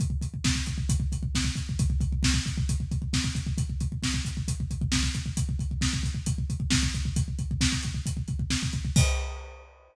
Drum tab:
CC |----------------|----------------|----------------|----------------|
HH |x-x---x-x-x---x-|x-x---x-x-x---x-|x-x---x-x-x---x-|x-x---x-x-x---x-|
SD |----o-------o---|----o-------o---|----o-------o---|----o-------o---|
BD |oooooooooooooooo|oooooooooooooooo|oooooooooooooooo|oooooooooooooooo|

CC |----------------|x---------------|
HH |x-x---x-x-x---x-|----------------|
SD |----o-------o---|----------------|
BD |oooooooooooooooo|o---------------|